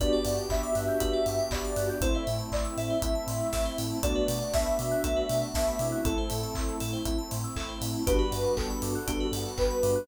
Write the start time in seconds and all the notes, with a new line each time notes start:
0.00 G1 B3 D4 F#4 G4 B4 D5, kick, closed hi-hat
0.13 D5
0.25 G2 F#5, open hi-hat
0.37 G5
0.49 G1 B3 D4 F#4 G4 E5 B5, kick, clap
0.63 D6
0.75 G2 F#6, open hi-hat
0.88 G6
1.00 G1 B3 D4 F#4 G4 B4, kick, closed hi-hat
1.13 D5
1.26 G2 F#5, open hi-hat
1.39 G5
1.51 G1 B3 D4 F#4 G4 D5 B5, kick, clap
1.65 D6
1.76 G2 F#6, open hi-hat
1.89 G6
2.01 A1 A3 C4 E4 A4 C5, kick, closed hi-hat
2.15 C5 E5
2.27 A2 E5, open hi-hat
2.39 A5
2.52 A1 A3 C4 E4 D5 C6, kick, clap
2.65 E6
2.77 A2 A4 E5, open hi-hat
2.90 C5
3.02 A1 A3 C4 E4 E5, kick, closed hi-hat
3.15 A5
3.27 A2 C6, open hi-hat
3.41 E6
3.53 A1 A3 C4 E4 A4, kick, snare
3.66 C5
3.78 A2 E5, open hi-hat
3.90 A5
4.03 B1 A3 B3 D4 F#4 A4 D5, kick, closed hi-hat
4.15 B4
4.28 B2 D5, open hi-hat
4.41 F#5
4.53 B1 A3 B3 D4 F#4 E5 A5, kick, snare
4.66 B5
4.79 B2 D6, open hi-hat
4.91 F#6
5.03 B1 A3 B3 D4 F#4 A4, kick, closed hi-hat
5.16 B4
5.29 B2 D5, open hi-hat
5.42 F#5
5.54 B1 A3 B3 D4 F#4 E5 A5, kick, snare
5.67 B5
5.79 B2 A3 C4 E4 D6, open hi-hat
5.92 F#6
6.05 A1 A3 C4 E4 A4, kick, closed hi-hat
6.18 C5
6.30 A2 E5, open hi-hat
6.43 A5
6.55 A1 A3 C4 E4 C6, kick, clap
6.69 E6
6.80 A2 A4, open hi-hat
6.93 C5
7.05 A1 A3 C4 E4 E5, kick, closed hi-hat
7.18 A5
7.31 A2 C6, open hi-hat
7.44 E6
7.56 A1 A3 C4 E4 A4, kick, clap
7.69 C5
7.81 A2 E5, open hi-hat
7.94 A5
8.06 G1 G3 B3 D4 F#4 G4 B4, kick, closed hi-hat
8.19 B4
8.32 G2 D5, open hi-hat
8.44 F#5
8.57 G1 A4 G5, kick, clap
8.70 B5
8.82 G2 D6, open hi-hat
8.95 F#6
9.07 G1 G3 B3 D4 F#4 G4, kick, closed hi-hat
9.20 B4
9.32 G2 D5, open hi-hat
9.46 F#5
9.57 G1 B4 G5, kick, clap
9.70 B5
9.83 G2 D6, open hi-hat
9.96 F#6